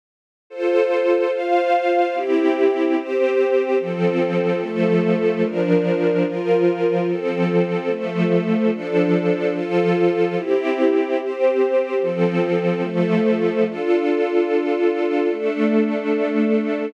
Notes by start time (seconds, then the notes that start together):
0.50 F4 A4 C5
1.32 F4 C5 F5
2.14 C4 E4 G4
2.96 C4 G4 C5
3.79 F3 C4 A4
4.61 F3 A3 A4
5.43 F3 D4 A#4
6.25 F3 F4 A#4
7.08 F3 C4 A4
7.89 F3 A3 A4
8.72 F3 D4 A4
9.54 F3 F4 A4
10.36 C4 E4 G4
11.18 C4 G4 C5
12.01 F3 C4 A4
12.82 F3 A3 A4
13.64 D4 F4 A4
15.29 A3 D4 A4